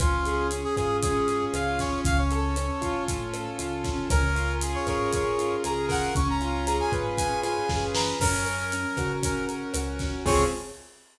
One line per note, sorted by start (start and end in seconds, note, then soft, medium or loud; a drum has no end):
0.00 0.66 C#2 loud
0.00 0.51 C#4 medium
0.00 0.47 F4 medium
0.00 kick loud
0.00 cross-stick loud
0.00 closed hi-hat loud
0.26 1.28 G#4 medium
0.26 closed hi-hat medium
0.51 1.02 C#4 medium
0.51 closed hi-hat loud
0.64 0.75 G#4 medium
0.76 1.43 G#2 medium
0.76 1.54 F4 medium
0.76 0.97 G#4 medium
0.76 kick medium
0.76 cross-stick medium
0.76 closed hi-hat medium
1.02 1.79 C#4 medium
1.02 1.45 G#4 medium
1.02 kick loud
1.02 closed hi-hat loud
1.28 2.02 G#4 medium
1.28 closed hi-hat medium
1.54 1.97 C#2 medium
1.54 2.04 F4 medium
1.54 1.79 F5 medium
1.54 cross-stick medium
1.54 closed hi-hat loud
1.79 2.56 C#4 medium
1.79 2.00 C#5 medium
1.79 kick medium
1.79 snare medium
1.79 closed hi-hat medium
2.04 2.70 C#2 loud
2.04 2.18 F5 medium
2.04 kick loud
2.04 closed hi-hat loud
2.18 3.04 C#5 medium
2.31 3.34 A4 medium
2.31 closed hi-hat medium
2.56 3.07 C#4 medium
2.56 cross-stick medium
2.56 closed hi-hat loud
2.81 3.48 A2 medium
2.81 3.58 F4 medium
2.81 kick medium
2.81 closed hi-hat medium
3.08 3.84 C#4 medium
3.08 kick medium
3.08 closed hi-hat loud
3.34 4.08 A4 medium
3.34 cross-stick medium
3.34 closed hi-hat medium
3.59 4.03 C#2 medium
3.59 4.07 F4 medium
3.59 closed hi-hat loud
3.84 4.08 C#4 medium
3.84 kick medium
3.84 snare medium
3.84 closed hi-hat medium
4.10 4.76 C#2 loud
4.10 5.13 C#4 medium
4.10 4.53 A#4 medium
4.10 kick loud
4.10 cross-stick loud
4.10 closed hi-hat loud
4.35 5.38 F4 medium
4.35 closed hi-hat medium
4.61 5.63 G#4 medium
4.61 closed hi-hat loud
4.75 4.87 C#5 medium
4.87 5.52 G#2 medium
4.87 5.88 A#4 medium
4.87 5.12 C#5 medium
4.87 kick medium
4.87 cross-stick loud
4.87 closed hi-hat medium
5.13 6.11 C#4 medium
5.13 5.56 C#5 medium
5.13 kick medium
5.13 closed hi-hat loud
5.38 6.11 F4 medium
5.38 closed hi-hat medium
5.64 6.08 C#2 medium
5.64 6.13 G#4 medium
5.64 5.86 A#5 medium
5.64 cross-stick medium
5.64 closed hi-hat loud
5.89 6.13 A#4 loud
5.89 6.14 F#5 medium
5.89 kick medium
5.89 snare medium
5.89 open hi-hat medium
6.15 6.81 C#2 loud
6.15 7.18 C#4 loud
6.15 6.28 C#6 medium
6.15 kick loud
6.15 closed hi-hat loud
6.29 6.66 A#5 medium
6.41 7.43 F4 medium
6.41 closed hi-hat medium
6.66 7.69 G#4 medium
6.66 6.78 A#5 medium
6.66 cross-stick medium
6.66 closed hi-hat loud
6.80 6.92 G#5 medium
6.92 7.57 G#2 medium
6.92 7.94 B4 medium
6.92 kick medium
6.92 closed hi-hat medium
7.17 8.16 C#4 medium
7.17 7.40 G#5 medium
7.17 kick medium
7.17 closed hi-hat loud
7.43 8.16 F4 medium
7.43 7.85 G#5 medium
7.43 cross-stick loud
7.43 closed hi-hat medium
7.69 8.13 F#2 medium
7.69 8.18 G#4 medium
7.69 kick medium
7.69 snare medium
7.94 8.19 B4 medium
7.94 8.19 A#5 medium
7.94 snare loud
8.20 8.85 F#2 loud
8.20 8.73 C#4 loud
8.20 9.12 A#4 medium
8.20 kick loud
8.20 cross-stick loud
8.20 crash loud
8.45 9.48 A#4 medium
8.45 closed hi-hat medium
8.72 9.22 C#4 medium
8.72 closed hi-hat loud
8.97 9.63 C#3 medium
8.97 9.75 F#4 medium
8.97 kick medium
8.97 cross-stick loud
8.97 closed hi-hat medium
9.23 10.01 C#4 medium
9.23 9.45 A#4 medium
9.23 kick medium
9.23 closed hi-hat loud
9.49 10.22 A#4 medium
9.49 closed hi-hat medium
9.74 10.18 C#2 medium
9.74 10.24 F#4 medium
9.74 cross-stick loud
9.74 closed hi-hat loud
9.99 10.25 C#4 medium
9.99 kick medium
9.99 snare medium
9.99 closed hi-hat medium
10.26 10.44 C#2 loud
10.26 10.43 C4 loud
10.26 10.43 C#4 medium
10.26 10.43 F4 loud
10.26 10.43 G#4 loud
10.26 10.44 C#5 loud
10.26 kick loud
10.26 crash loud